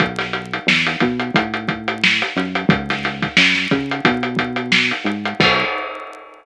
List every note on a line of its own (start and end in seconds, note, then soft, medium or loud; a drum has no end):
0.00 0.59 B1 medium
0.00 kick medium
0.00 closed hi-hat medium
0.19 snare soft
0.19 closed hi-hat medium
0.33 closed hi-hat medium
0.54 closed hi-hat medium
0.67 0.96 E2 medium
0.67 snare loud
0.87 closed hi-hat medium
1.00 1.31 B2 medium
1.00 kick medium
1.00 closed hi-hat medium
1.20 closed hi-hat medium
1.34 2.23 A2 medium
1.34 kick medium
1.34 closed hi-hat loud
1.54 closed hi-hat medium
1.68 kick medium
1.68 closed hi-hat medium
1.88 closed hi-hat medium
2.04 snare loud
2.22 closed hi-hat medium
2.36 2.65 F#2 medium
2.36 snare soft
2.36 closed hi-hat medium
2.55 closed hi-hat medium
2.69 3.28 C#2 medium
2.69 kick loud
2.69 closed hi-hat loud
2.90 snare medium
2.90 closed hi-hat medium
3.04 snare soft
3.04 closed hi-hat medium
3.22 kick medium
3.22 snare soft
3.22 closed hi-hat medium
3.37 3.67 F#2 medium
3.37 snare loud
3.55 snare medium
3.71 4.01 C#3 medium
3.71 kick medium
3.71 closed hi-hat medium
3.91 closed hi-hat medium
4.05 4.93 B2 medium
4.05 kick medium
4.05 closed hi-hat loud
4.23 closed hi-hat medium
4.37 kick medium
4.37 closed hi-hat medium
4.56 closed hi-hat medium
4.72 snare loud
4.91 closed hi-hat medium
5.04 5.34 G#2 medium
5.04 closed hi-hat medium
5.25 closed hi-hat medium
5.39 5.64 B1 loud
5.39 kick loud
5.39 crash loud